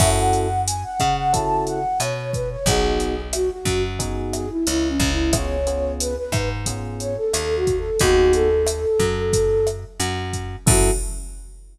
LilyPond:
<<
  \new Staff \with { instrumentName = "Flute" } { \time 4/4 \key fis \dorian \tempo 4 = 90 e''16 fis''8. gis''16 fis''8 fis''16 a''8 fis''8 cis''8 b'16 cis''16 | gis'4 fis'16 fis'8 r8. gis'16 e'16 \tuplet 3/2 { e'8 cis'8 e'8 } | cis''4 b'16 b'8 r8. cis''16 a'16 \tuplet 3/2 { a'8 fis'8 a'8 } | fis'8 a'2~ a'8 r4 |
fis'4 r2. | }
  \new Staff \with { instrumentName = "Electric Piano 1" } { \time 4/4 \key fis \dorian <cis' e' fis' a'>2 <cis' e' fis' a'>2 | <b dis' fis' gis'>2 <b dis' fis' gis'>2 | <b cis' eis' gis'>8 <b cis' eis' gis'>4. <b cis' eis' gis'>2 | <b dis' fis' gis'>1 |
<cis' e' fis' a'>4 r2. | }
  \new Staff \with { instrumentName = "Electric Bass (finger)" } { \clef bass \time 4/4 \key fis \dorian fis,4. cis4. b,4 | b,,4. fis,4. cis,8 cis,8~ | cis,4. gis,4. dis,4 | dis,4. fis,4. fis,4 |
fis,4 r2. | }
  \new DrumStaff \with { instrumentName = "Drums" } \drummode { \time 4/4 <cymc bd ss>8 hh8 hh8 <hh bd ss>8 <hh bd>8 hh8 <hh ss>8 <hh bd>8 | <hh bd>8 hh8 <hh ss>8 <hh bd>8 <hh bd>8 <hh ss>8 hh8 <hh bd>8 | <hh bd ss>8 hh8 hh8 <hh bd ss>8 <hh bd>8 hh8 <hh ss>8 <hh bd>8 | <hh bd>8 hh8 <hh ss>8 <hh bd>8 <hh bd>8 <hh ss>8 hh8 <hh bd>8 |
<cymc bd>4 r4 r4 r4 | }
>>